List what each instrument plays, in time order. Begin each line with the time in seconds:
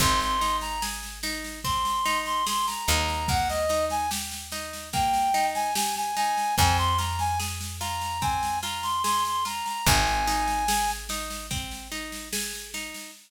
0.00 electric bass (finger) G#1, orchestral harp C4, clarinet C6, kick, snare
0.20 clarinet C6, snare
0.41 orchestral harp D#4, snare
0.61 clarinet A#5, snare
0.82 orchestral harp G#4, snare
1.03 snare
1.23 orchestral harp D#4, snare
1.44 snare
1.64 orchestral harp C4, clarinet C6, kick, snare
1.85 snare
2.05 orchestral harp D#4, snare
2.26 clarinet C6, snare
2.47 orchestral harp G#4, clarinet C6, snare
2.67 clarinet A#5, snare
2.88 electric bass (finger) D#2, orchestral harp D#4, clarinet A#5, snare
3.08 snare
3.28 orchestral harp A#3, clarinet F#5, kick, snare
3.49 clarinet D#5, snare
3.69 orchestral harp D#4, snare
3.90 clarinet G#5, snare
4.11 orchestral harp G4, snare
4.32 snare
4.52 orchestral harp D#4, snare
4.73 snare
4.93 orchestral harp A#3, clarinet G5, kick, snare
5.13 snare
5.34 orchestral harp D#4, snare
5.54 clarinet G#5, snare
5.75 orchestral harp G4, clarinet G#5, snare
5.96 clarinet G#5, snare
6.16 orchestral harp D#4, clarinet G#5, snare
6.38 snare
6.58 electric bass (finger) F2, orchestral harp C4, clarinet G#5, kick, snare
6.78 clarinet C6, snare
6.98 orchestral harp F4, clarinet A#5, snare
7.19 clarinet G#5, snare
7.40 orchestral harp G#4, snare
7.61 snare
7.80 orchestral harp F4, clarinet A#5, snare
8.01 snare
8.21 orchestral harp C4, clarinet G#5, kick, snare
8.43 snare
8.63 orchestral harp F4, clarinet A#5, snare
8.83 clarinet C6, snare
9.04 orchestral harp G#4, clarinet C6, snare
9.25 clarinet C6, snare
9.45 orchestral harp F4, clarinet A#5, snare
9.66 clarinet A#5, snare
9.86 electric bass (finger) G#1, orchestral harp C4, clarinet G#5, kick, snare
10.07 snare
10.27 orchestral harp D#4, snare
10.47 snare
10.68 orchestral harp G#4, snare
10.88 snare
11.09 orchestral harp D#4, snare
11.30 snare
11.51 orchestral harp C4, kick, snare
11.71 snare
11.92 orchestral harp D#4, snare
12.12 snare
12.33 orchestral harp G#4, snare
12.53 snare
12.74 orchestral harp D#4, snare
12.94 snare